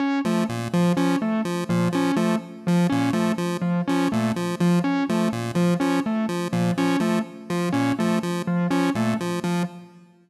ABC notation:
X:1
M:4/4
L:1/8
Q:1/4=124
K:none
V:1 name="Lead 1 (square)" clef=bass
z F, _B,, F, F, z F, B,, | F, F, z F, _B,, F, F, z | F, _B,, F, F, z F, B,, F, | F, z F, _B,, F, F, z F, |
_B,, F, F, z F, B,, F, F, |]
V:2 name="Vibraphone"
_D A, z F, D A, z F, | _D A, z F, D A, z F, | _D A, z F, D A, z F, | _D A, z F, D A, z F, |
_D A, z F, D A, z F, |]